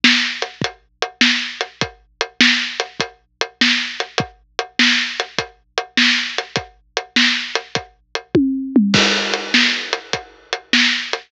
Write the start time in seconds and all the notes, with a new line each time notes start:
0.04 snare
0.42 closed hi-hat
0.61 kick, closed hi-hat
1.02 closed hi-hat
1.21 snare
1.61 closed hi-hat
1.81 kick, closed hi-hat
2.21 closed hi-hat
2.41 snare
2.80 closed hi-hat
3.00 kick, closed hi-hat
3.41 closed hi-hat
3.61 snare
4.00 closed hi-hat
4.18 kick, closed hi-hat
4.59 closed hi-hat
4.79 snare
5.20 closed hi-hat
5.38 kick, closed hi-hat
5.78 closed hi-hat
5.97 snare
6.38 closed hi-hat
6.56 kick, closed hi-hat
6.97 closed hi-hat
7.16 snare
7.55 closed hi-hat
7.75 kick, closed hi-hat
8.15 closed hi-hat
8.35 kick, high tom
8.76 mid tom
8.94 kick, crash
9.34 closed hi-hat
9.54 snare
9.93 closed hi-hat
10.13 kick, closed hi-hat
10.53 closed hi-hat
10.73 snare
11.13 closed hi-hat